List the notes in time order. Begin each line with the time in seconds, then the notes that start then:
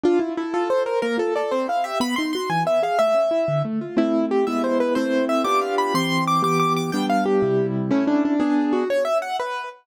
0.03 D4 F4
0.19 E4 F4
0.37 E4 A4
0.54 F4 A4
0.69 A4 C5
0.86 A#4 C5
1.02 A#3 A#4
1.17 F4 A4
1.36 A4 D5
1.51 C4 C5
1.68 E4 F5
1.84 G4 E5
2.00 B3 B5
2.16 D#4 C6
2.33 F#4 C6
2.50 E3 G#5
2.65 B3 E5
2.83 G#4 F5
2.99 A3 E5
3.14 C#4
3.31 E4
3.48 D3
3.65 A3
3.81 F4
3.97 A3 C4 E4
4.31 G4
4.47 G#3 B3 E4 E5
4.64 C5
4.80 B4
4.95 A3 C4 E4 C5
5.29 E5
5.44 B3 D4 F4 G4 D6
5.61 F5
5.78 B5
5.94 E3 C4 G4 C6
6.27 D6
6.43 E3 B3 G4 D6
6.60 D6
6.77 D6
6.92 G3 B3 D4 G5
7.10 F5
7.26 G4
7.42 C3 G3 E4
7.91 A3 C#4 E4
8.07 D4
8.25 D4
8.40 B3 D4 G#4
8.73 F#4
8.90 C#5
9.05 E5
9.22 F#5
9.40 B4